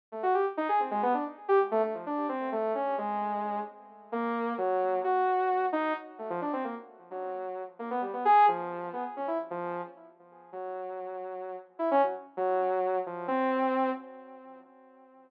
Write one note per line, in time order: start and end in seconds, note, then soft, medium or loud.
0.12 0.22 A3 medium
0.23 0.33 F#4 medium
0.34 0.45 G4 medium
0.57 0.68 D#4 loud
0.69 0.79 G#4 medium
0.80 0.90 C4 medium
0.91 1.01 G#3 loud
1.03 1.13 B3 loud
1.14 1.24 D4 medium
1.48 1.59 G4 loud
1.71 1.82 A3 loud
1.83 1.93 A3 medium
1.94 2.05 F3 medium
2.06 2.27 D4 medium
2.29 2.49 C4 medium
2.52 2.73 A3 medium
2.75 2.95 C#4 medium
2.98 3.60 G#3 medium
4.12 4.53 A#3 loud
4.58 4.99 F#3 loud
5.04 5.66 F#4 medium
5.73 5.93 D#4 loud
6.19 6.29 A3 soft
6.30 6.40 F3 loud
6.42 6.52 D4 medium
6.53 6.63 C4 medium
6.64 6.74 A#3 medium
7.11 7.62 F#3 medium
7.79 7.89 A#3 medium
7.90 8.01 B3 medium
8.02 8.12 G3 medium
8.13 8.24 B3 medium
8.25 8.46 G#4 loud
8.48 8.89 F3 medium
8.93 9.03 B3 medium
9.17 9.27 C#4 medium
9.27 9.38 E4 medium
9.50 9.81 F3 loud
10.52 11.55 F#3 medium
11.79 11.89 E4 medium
11.91 12.01 C#4 loud
12.03 12.13 F#3 medium
12.37 12.99 F#3 loud
13.06 13.27 F3 medium
13.28 13.90 C4 loud